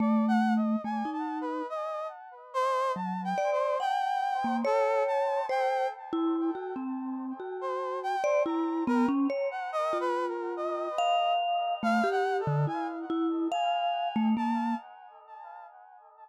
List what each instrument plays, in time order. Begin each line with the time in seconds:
0.00 vibraphone A3, brass section D5
0.28 brass section F#5
0.56 brass section D#5
0.84 vibraphone A3, brass section G#5
1.05 vibraphone D#4
1.13 brass section A5
1.41 brass section B4
1.69 brass section D#5
2.54 brass section C5
2.96 vibraphone F#3, brass section A5
3.24 brass section G5
3.38 vibraphone D5
3.52 brass section C5
3.80 vibraphone F#5, brass section G5
4.44 vibraphone A#3
4.65 brass section A4, vibraphone C#5
5.07 brass section A5
5.49 vibraphone C5, brass section G5
6.13 vibraphone E4
6.55 vibraphone F#4
6.76 vibraphone C4
7.40 vibraphone F#4
7.61 brass section C5
8.03 brass section G5
8.24 brass section C5, vibraphone D5
8.45 vibraphone E4, brass section A#5
8.87 vibraphone B3, brass section A#4
9.08 vibraphone C#4
9.30 vibraphone C#5
9.51 brass section F#5
9.72 brass section D#5
9.93 vibraphone F4
10.00 brass section B4
10.28 brass section A#4
10.57 brass section D#5
10.98 vibraphone F5
11.83 vibraphone A3, brass section F5
12.04 vibraphone G4
12.11 brass section F#5
12.40 brass section A4
12.47 vibraphone D3
12.67 vibraphone E4, brass section G#5
13.10 vibraphone E4
13.52 vibraphone F5, brass section G#5
14.16 vibraphone A3
14.37 vibraphone A#3, brass section A5